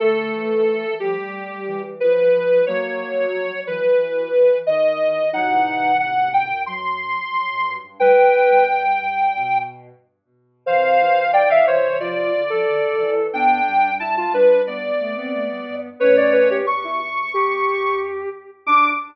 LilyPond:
<<
  \new Staff \with { instrumentName = "Ocarina" } { \time 4/4 \key d \dorian \tempo 4 = 90 a'4. g'4. b'4 | cis''4. b'4. dis''4 | fis''4 fis''8 g''8 c'''2 | g''2~ g''8 r4. |
f''4 g''16 f''16 cis''8 d''2 | g''4 a''16 a''16 b'8 d''2 | cis''4 cis'''2~ cis'''8 r8 | d'''4 r2. | }
  \new Staff \with { instrumentName = "Ocarina" } { \time 4/4 \key d \dorian a4 r2. | ais4 r2. | dis'4 r2. | b'4 r2. |
c''4 d''16 e''16 c''8 f'8. a'4~ a'16 | d'4 e'16 f'16 d'8 b8. b4~ b16 | b'16 d''16 b'16 g'16 r16 e'16 r8 g'4. r8 | d'4 r2. | }
  \new Staff \with { instrumentName = "Ocarina" } { \time 4/4 \key d \dorian d8 e4 f16 r8. e4 f8 | fis8. r8. fis16 r2 r16 | <a, c>2 fis2 | g16 r8 g4.~ g16 r4. |
e8 c4 c4 d16 f16 d16 c16 r8 | b8 g4 g4 a16 c'16 a16 g16 r8 | <a cis'>4 r2. | d'4 r2. | }
  \new Staff \with { instrumentName = "Ocarina" } { \time 4/4 \key d \dorian a4. g4. f4 | fis4. e4. dis4 | fis16 e8. dis,8 fis,16 fis,4~ fis,16 r16 fis,16 g,16 g,16 | d,16 d,16 e,4 g,8 b,4 r4 |
c8 e4. f8 r4 e8 | e,8 g,4. g,8 r4 g,8 | a,16 f,8 e,16 e,2~ e,8 r8 | d,4 r2. | }
>>